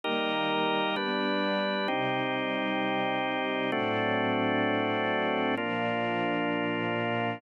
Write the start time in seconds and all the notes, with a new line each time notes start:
0.04 D#3 G3 A#3 D#4 G4 A#4
0.96 G3 B3 D4 B4
1.88 C3 G3 C4 D#4 G4
3.72 A2 F#3 A3 C4 D4 F#4
5.57 A#2 F3 A#3 D4 F4